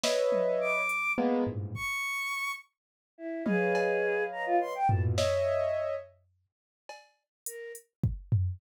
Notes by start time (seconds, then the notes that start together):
0.04 B4 C#5 D#5 E5, snare
0.32 high tom
0.61 D6
0.89 closed hi-hat
1.18 G#3 A#3 B3
1.47 G2 G#2 A2 A#2
1.75 C#6, kick
3.18 E4
3.46 G#4 B4 C#5 D#5 F5, high tom
3.75 cowbell
4.32 A#5
4.46 F4
4.61 C6
4.75 G5
4.89 A2 A#2 B2 A4, floor tom
5.18 C#5 D#5 E5, snare
6.89 cowbell
7.46 A#4, closed hi-hat
7.75 closed hi-hat
8.04 kick
8.32 floor tom